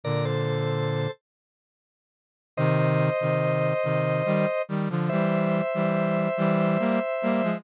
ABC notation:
X:1
M:3/4
L:1/16
Q:1/4=71
K:Cm
V:1 name="Drawbar Organ"
[Bd] [=Ac]5 z6 | [ce]12 | [c=e]12 |]
V:2 name="Brass Section"
[B,,D,]6 z6 | [C,E,]3 [C,E,]3 [C,E,]2 [E,G,] z [E,G,] [D,F,] | [=E,G,]3 [E,G,]3 [E,G,]2 [G,B,] z [G,B,] [F,A,] |]